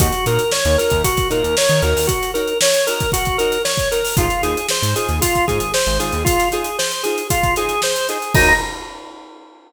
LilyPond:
<<
  \new Staff \with { instrumentName = "Drawbar Organ" } { \time 4/4 \key ees \dorian \tempo 4 = 115 ges'8 bes'8 des''8 bes'8 ges'8 bes'8 des''8 bes'8 | ges'8 bes'8 des''8 bes'8 ges'8 bes'8 des''8 bes'8 | f'8 aes'8 c''8 aes'8 f'8 aes'8 c''8 aes'8 | f'8 aes'8 c''8 aes'8 f'8 aes'8 c''8 aes'8 |
ees'4 r2. | }
  \new Staff \with { instrumentName = "Acoustic Guitar (steel)" } { \time 4/4 \key ees \dorian <ees' ges' bes' des''>8 <ees' ges' bes' des''>4 <ees' ges' bes' des''>4 <ees' ges' bes' des''>4 <ees' ges' bes' des''>8~ | <ees' ges' bes' des''>8 <ees' ges' bes' des''>4 <ees' ges' bes' des''>4 <ees' ges' bes' des''>4 <ees' ges' bes' des''>8 | <ees' f' aes' c''>8 <ees' f' aes' c''>4 <ees' f' aes' c''>4 <ees' f' aes' c''>4 <ees' f' aes' c''>8~ | <ees' f' aes' c''>8 <ees' f' aes' c''>4 <ees' f' aes' c''>4 <ees' f' aes' c''>4 <ees' f' aes' c''>8 |
<ees' ges' bes' des''>4 r2. | }
  \new Staff \with { instrumentName = "Synth Bass 1" } { \clef bass \time 4/4 \key ees \dorian ees,8 bes,8. ees,8 ees,8. bes,16 ees,8 ees16 ees,16 ees,16~ | ees,1 | aes,,8 ees,8. aes,8 ees,8. aes,16 aes,,8 aes,,16 aes,,16 ees,16~ | ees,1 |
ees,4 r2. | }
  \new DrumStaff \with { instrumentName = "Drums" } \drummode { \time 4/4 <hh bd>16 hh16 hh16 hh16 sn16 hh16 hh16 <hh bd>16 <hh bd>16 <hh bd>16 hh16 hh16 sn16 hh16 hh16 hho16 | <hh bd>16 hh16 hh16 hh16 sn16 <hh sn>16 hh16 <hh bd>16 <hh bd>16 <hh bd>16 hh16 <hh sn>16 sn16 <hh bd>16 hh16 <hho sn>16 | <hh bd>16 hh16 hh16 hh16 sn16 hh16 hh16 hh16 <hh bd>16 <hh bd>16 <hh bd>16 hh16 sn16 <hh sn>16 hh16 hh16 | <hh bd>16 <hh sn>16 hh16 hh16 sn16 hh16 hh16 hh16 <hh bd>16 <hh bd>16 <hh sn>16 hh16 sn16 hh16 hh16 hh16 |
<cymc bd>4 r4 r4 r4 | }
>>